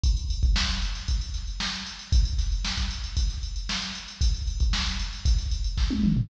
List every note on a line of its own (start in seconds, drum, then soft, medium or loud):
0.03 kick medium
0.03 closed hi-hat medium
0.17 closed hi-hat medium
0.30 closed hi-hat medium
0.43 kick medium
0.43 closed hi-hat medium
0.56 snare loud
0.69 snare soft
0.69 closed hi-hat medium
0.82 closed hi-hat medium
0.95 snare soft
0.95 closed hi-hat medium
1.08 kick medium
1.08 closed hi-hat medium
1.21 closed hi-hat medium
1.34 snare soft
1.34 closed hi-hat medium
1.47 closed hi-hat medium
1.60 snare loud
1.73 closed hi-hat medium
1.86 closed hi-hat medium
1.99 closed hi-hat medium
2.12 kick loud
2.12 closed hi-hat loud
2.25 closed hi-hat medium
2.38 snare soft
2.38 closed hi-hat medium
2.52 closed hi-hat medium
2.64 snare loud
2.77 kick medium
2.77 closed hi-hat medium
2.91 closed hi-hat medium
3.04 snare soft
3.04 closed hi-hat medium
3.17 kick medium
3.17 closed hi-hat loud
3.30 snare soft
3.30 closed hi-hat medium
3.43 closed hi-hat medium
3.56 closed hi-hat medium
3.69 snare loud
3.82 snare soft
3.82 closed hi-hat medium
3.95 closed hi-hat medium
4.08 closed hi-hat medium
4.21 kick medium
4.21 closed hi-hat loud
4.34 closed hi-hat medium
4.47 closed hi-hat medium
4.60 kick medium
4.60 closed hi-hat medium
4.73 snare loud
4.86 snare soft
4.86 closed hi-hat medium
4.99 closed hi-hat medium
5.13 closed hi-hat medium
5.25 kick medium
5.25 closed hi-hat medium
5.38 snare soft
5.38 closed hi-hat medium
5.51 closed hi-hat medium
5.64 closed hi-hat medium
5.77 kick medium
5.77 snare medium
5.90 high tom medium
6.03 mid tom medium
6.17 floor tom loud